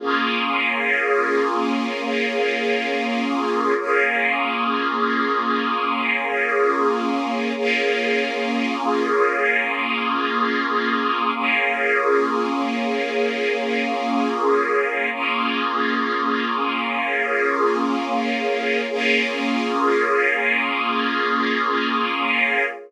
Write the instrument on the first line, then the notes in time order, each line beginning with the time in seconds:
string ensemble 1
0.00 A#3 C#4 F4 G#4
3.78 A#3 C#4 F4 G#4
7.57 A#3 C#4 F4 G#4
11.34 A#3 C#4 F4 G#4
15.12 A#3 C#4 F4 G#4
18.89 A#3 C#4 F4 G#4